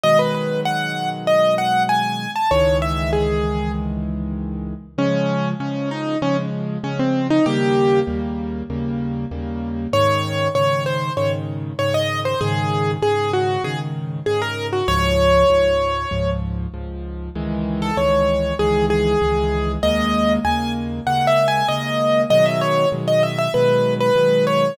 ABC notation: X:1
M:4/4
L:1/16
Q:1/4=97
K:C#m
V:1 name="Acoustic Grand Piano"
d B B2 f3 z d2 f2 g3 a | c2 e2 G4 z8 | [K:Db] D4 D2 E2 D z3 D C2 E | =G4 z12 |
d4 d2 c2 d z3 d e2 c | A4 A2 G2 A z3 A B2 G | d10 z6 | [K:C#m] z3 A c4 G2 G6 |
d4 g2 z2 (3f2 e2 g2 d4 | d e c2 z d e e B3 B3 c2 |]
V:2 name="Acoustic Grand Piano"
[B,,D,F,G,]16 | [C,,D,E,G,]16 | [K:Db] [D,F,A,]4 [D,F,A,]4 [D,F,A,]4 [D,F,A,]4 | [E,,D,=G,B,]4 [E,,D,G,B,]4 [E,,D,G,B,]4 [E,,D,G,B,]4 |
[A,,D,E,]4 [A,,D,E,]4 [A,,D,E,]4 [A,,D,E,]4 | [A,,D,E,]4 [A,,D,E,]4 [A,,D,E,]4 [A,,D,E,]4 | [D,,A,,F,]4 [D,,A,,F,]4 [D,,A,,F,]4 [D,,A,,F,]4 | [K:C#m] [C,,D,E,G,]4 [C,,D,E,G,]4 [C,,D,E,G,]4 [C,,D,E,G,]4 |
[D,,C,G,^A,]4 [D,,C,G,A,]4 [D,,C,G,A,]4 [D,,C,G,A,]4 | [B,,D,F,G,]4 [B,,D,F,G,]4 [B,,D,F,G,]4 [B,,D,F,G,]4 |]